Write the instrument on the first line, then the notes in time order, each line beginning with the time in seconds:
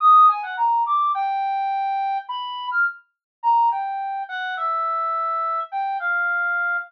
brass section
0.00 D#6
0.29 G#5
0.43 F#5
0.57 A#5
0.86 D6
1.15 G5
2.29 B5
2.71 F6
3.43 A#5
3.71 G5
4.29 F#5
4.57 E5
5.72 G5
6.00 F5